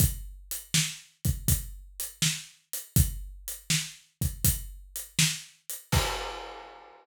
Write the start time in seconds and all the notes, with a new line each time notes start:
0.00 kick, closed hi-hat
0.51 closed hi-hat
0.74 snare
1.25 kick, closed hi-hat
1.48 kick, closed hi-hat
2.00 closed hi-hat
2.22 snare
2.73 closed hi-hat
2.96 kick, closed hi-hat
3.48 closed hi-hat
3.70 snare
4.21 kick, closed hi-hat
4.44 kick, closed hi-hat
4.96 closed hi-hat
5.19 snare
5.70 closed hi-hat
5.92 kick, crash